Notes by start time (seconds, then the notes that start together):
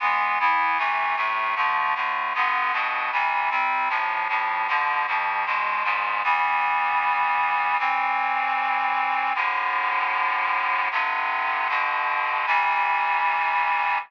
0.00 E3 G#3 B3
0.40 E3 B3 E4
0.78 C3 E3 A3
1.16 A2 C3 A3
1.56 D3 F3 A3
1.95 A2 D3 A3
2.34 G2 D3 B3
2.73 G2 B2 B3
3.12 C3 E3 G3
3.50 C3 G3 C4
3.89 A2 C3 F3
4.29 F2 A2 F3
4.68 B2 D3 F3
5.07 F2 B2 F3
5.46 E2 B2 G#3
5.84 E2 G#2 G#3
6.23 E3 G3 B3
7.79 A2 E3 C4
9.35 F#2 A2 D3
10.91 G2 C3 D3
11.69 G2 B2 D3
12.46 C3 E3 G3